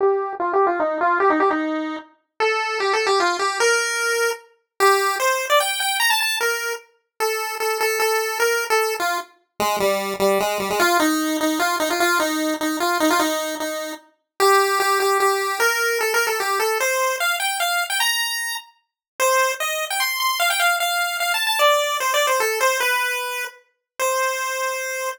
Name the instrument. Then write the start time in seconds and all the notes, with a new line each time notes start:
lead 1 (square)
0.01 G4
0.40 F4
0.53 G4
0.67 F4
0.80 D#4
1.01 F4
1.20 G4
1.30 D#4
1.40 G4
1.51 D#4
2.40 A4
2.80 G4
2.93 A4
3.07 G4
3.20 F4
3.39 G4
3.60 A#4
4.80 G4
5.20 C5
5.50 D5
5.60 G5
5.80 G5
6.00 A#5
6.10 A5
6.21 A5
6.41 A#4
7.20 A4
7.60 A4
7.81 A4
8.00 A4
8.40 A#4
8.70 A4
9.00 F4
9.60 G#3
9.80 G3
10.20 G3
10.40 G#3
10.60 G3
10.70 G#3
10.80 F4
11.00 D#4
11.41 D#4
11.60 F4
11.80 D#4
11.90 F4
12.00 F4
12.20 D#4
12.61 D#4
12.80 F4
13.00 D#4
13.10 F4
13.19 D#4
13.60 D#4
14.40 G4
14.80 G4
15.00 G4
15.20 G4
15.60 A#4
16.01 A4
16.14 A#4
16.27 A4
16.40 G4
16.60 A4
16.80 C5
17.20 F5
17.40 G5
17.60 F5
17.90 G5
18.00 A#5
19.20 C5
19.60 D#5
19.90 G5
20.00 C6
20.20 C6
20.40 F5
20.50 G5
20.60 F5
20.80 F5
21.20 F5
21.34 A5
21.47 A5
21.59 D5
22.00 C5
22.14 D5
22.27 C5
22.40 A4
22.61 C5
22.80 B4
23.99 C5